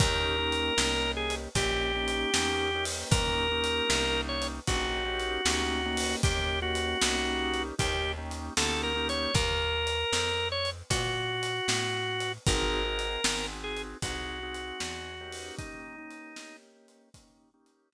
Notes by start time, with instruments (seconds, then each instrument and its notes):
0.00 electric bass (finger) D#2, drawbar organ A#3 C#4 D#4 G4 A#4, kick, closed hi-hat
0.38 drawbar organ A#3 C#4 D#4 G4
0.52 closed hi-hat
0.77 electric bass (finger) C2, drawbar organ A#3 C#4 D#4 G4, snare
1.17 drawbar organ G#4
1.30 closed hi-hat
1.55 electric bass (finger) A#1, drawbar organ A#3 C#4 D#4 G4, kick, closed hi-hat
1.95 drawbar organ A#3 C#4 D#4 G4
2.08 closed hi-hat
2.34 electric bass (finger) E2, drawbar organ A#3 C#4 D#4 G4, snare
2.75 drawbar organ A#3 C#4 D#4 G4
2.85 open hi-hat
3.11 electric bass (finger) D#2, drawbar organ A#3 C#4 D#4 G4 A#4, kick, closed hi-hat
3.51 drawbar organ A#3 C#4 D#4 G4
3.64 closed hi-hat
3.88 electric bass (finger) C2, drawbar organ A#3 C#4 D#4 G4, snare
4.29 drawbar organ C#5
4.42 closed hi-hat
4.67 electric bass (finger) A#1, drawbar organ A#3 C#4 D#4 F#4 G4, kick, closed hi-hat
5.05 drawbar organ A#3 C#4 D#4 G4
5.20 closed hi-hat
5.45 electric bass (finger) D2, drawbar organ A#3 C#4 D#4 G4, snare
5.85 drawbar organ A#3 C#4 D#4 G4
5.97 open hi-hat
6.23 electric bass (finger) D#2, drawbar organ A#3 C#4 D#4 G4, kick, closed hi-hat
6.62 drawbar organ A#3 C#4 D#4 F#4 G4
6.75 closed hi-hat
7.01 electric bass (finger) C2, drawbar organ A#3 C#4 D#4 G4, snare
7.54 closed hi-hat
7.78 electric bass (finger) D#2, drawbar organ A#3 C#4 D#4 G4, kick, closed hi-hat
8.18 drawbar organ A#3 C#4 D#4 G4
8.31 closed hi-hat
8.57 electric bass (finger) D2, drawbar organ A#3 C#4 D#4 G4 A4, snare
8.83 drawbar organ A#4
8.96 drawbar organ A#3 C#4 D#4 G4
9.09 drawbar organ C#5, closed hi-hat
9.34 electric bass (finger) D#2, drawbar organ A#4, kick, closed hi-hat
9.87 closed hi-hat
10.13 electric bass (finger) F2, snare
10.52 drawbar organ C#5
10.65 closed hi-hat
10.90 electric bass (finger) A#2, drawbar organ F#4, kick, closed hi-hat
11.43 closed hi-hat
11.68 electric bass (finger) A2, snare
12.20 closed hi-hat
12.47 electric bass (finger) G#1, drawbar organ C4 D#4 F#4 G#4 A#4, kick, closed hi-hat
12.85 drawbar organ C4 D#4 F#4 G#4
12.99 closed hi-hat
13.24 electric bass (finger) G#1, drawbar organ C4 D#4 F#4 G#4, snare
13.64 drawbar organ G#4
13.77 closed hi-hat
14.02 electric bass (finger) C2, drawbar organ C4 D#4 F#4 G#4, kick, closed hi-hat
14.43 drawbar organ C4 D#4 F#4 G#4
14.55 closed hi-hat
14.79 electric bass (finger) E2, drawbar organ C4 D#4 F#4 G#4, snare
15.21 drawbar organ A#3 C#4 D#4 G4
15.32 open hi-hat
15.58 drawbar organ D#4, kick, closed hi-hat
15.98 drawbar organ A#3 C#4 D#4 G4
16.11 closed hi-hat
16.36 drawbar organ A#3 C#4 D#4 G4, snare
16.88 closed hi-hat
17.14 drawbar organ A#3 C#4 D#4 G4, kick, closed hi-hat
17.54 drawbar organ A#3 C#4 D#4 G4
17.66 closed hi-hat
17.92 drawbar organ A#3 C#4 D#4 G4, snare